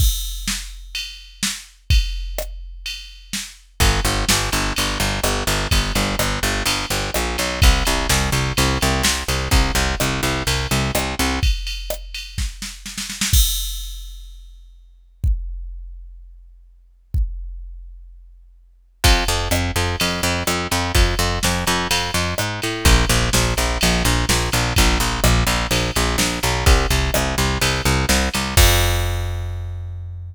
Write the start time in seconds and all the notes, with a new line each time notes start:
0.00 kick, crash
0.48 snare
0.95 ride
1.43 snare
1.90 kick, ride
2.38 cross-stick
2.86 ride
3.33 snare
3.80 G1, kick, ride
4.04 G1, ride
4.29 G1, snare
4.52 G1, ride
4.76 G1, ride
5.00 G1, ride
5.24 G1, cross-stick
5.47 G1, ride
5.71 G1, kick, ride
5.95 G1, ride
6.19 G1, cross-stick
6.43 G1, ride
6.66 G1, ride
6.90 G1, ride
7.14 A#1, cross-stick
7.38 B1, ride
7.62 C2, kick, ride
7.85 C2, ride
8.09 C2, snare
8.32 C2, ride
8.57 C2, ride
8.81 C2, ride
9.03 C2, snare
9.28 C2, ride
9.51 C2, kick, ride
9.75 C2, ride
10.00 C2, cross-stick
10.23 C2, ride
10.47 C2, ride
10.71 C2, ride
10.95 C2, cross-stick
11.19 C2, ride
11.43 kick, ride
11.67 ride
11.90 cross-stick
12.14 ride
12.38 kick, snare
12.62 snare
12.86 snare
12.98 snare
13.10 snare
13.21 snare
13.33 kick, crash
15.24 kick
17.14 kick
19.04 F2, kick, ride
19.28 F2, ride
19.51 F2, cross-stick
19.76 F2, ride
20.00 F2, ride
20.23 F2, ride
20.47 F2, cross-stick
20.71 F2, ride
20.95 F2, kick, ride
21.19 F2, ride
21.43 F2, snare
21.67 F2, ride
21.91 F2, ride
22.14 F2, ride
22.38 G#2, cross-stick
22.62 A2, ride
22.85 A#1, kick, ride
23.09 A#1, ride
23.33 A#1, snare
23.57 A#1, ride
23.81 A#1, ride
24.05 A#1, ride
24.29 A#1, snare
24.52 A#1, ride
24.76 A#1, kick, ride
25.00 A#1, ride
25.24 A#1, cross-stick
25.47 A#1, ride
25.71 A#1, ride
25.96 A#1, ride
26.18 A#1, snare
26.43 B1, ride
26.66 C2, kick, ride
26.90 C2, ride
27.14 C2, cross-stick
27.38 C2, ride
27.61 C2, ride
27.85 C2, ride
28.09 C2, snare
28.34 C2, ride
28.57 F2, kick, crash